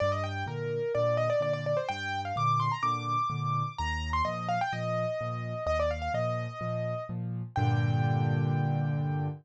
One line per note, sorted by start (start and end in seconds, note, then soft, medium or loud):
0.00 0.44 G2 medium
0.00 0.11 D5 loud
0.12 0.23 D#5 loud
0.24 0.45 G5 loud
0.46 0.79 A#2 medium
0.46 0.79 D3 medium
0.46 0.92 A#4 medium
0.95 1.28 A#2 medium
0.95 1.28 D3 medium
0.95 1.17 D5 loud
1.17 1.29 D#5 loud
1.30 1.41 D5 loud
1.40 1.73 A#2 medium
1.40 1.73 D3 medium
1.40 1.53 D5 loud
1.53 1.65 D5 loud
1.66 1.77 D5 medium
1.77 1.88 C5 medium
1.89 2.32 G2 medium
1.89 2.21 G5 loud
2.25 2.36 F5 medium
2.36 2.69 A#2 medium
2.36 2.69 D3 medium
2.36 2.60 D6 loud
2.60 2.71 C6 medium
2.72 2.83 A#5 medium
2.83 3.16 A#2 medium
2.83 3.16 D3 medium
2.83 3.74 D6 loud
3.30 3.63 A#2 medium
3.30 3.63 D3 medium
3.78 4.22 D#2 medium
3.78 4.09 A#5 loud
4.13 4.24 C6 loud
4.25 4.58 A#2 medium
4.25 4.58 F3 medium
4.25 4.47 D#5 medium
4.49 4.60 F5 loud
4.61 4.72 G5 loud
4.73 5.06 A#2 medium
4.73 5.06 F3 medium
4.73 5.64 D#5 loud
5.21 5.54 A#2 medium
5.21 5.54 F3 medium
5.66 6.09 D#2 medium
5.66 5.78 D#5 loud
5.80 5.91 D5 loud
5.91 6.01 F5 medium
6.02 6.13 F5 loud
6.14 6.47 A#2 medium
6.14 6.47 F3 medium
6.14 7.04 D#5 medium
6.61 6.94 A#2 medium
6.61 6.94 F3 medium
7.09 7.42 A#2 medium
7.09 7.42 F3 medium
7.56 9.28 G2 loud
7.56 9.28 A#2 loud
7.56 9.28 D3 loud
7.56 9.27 G5 loud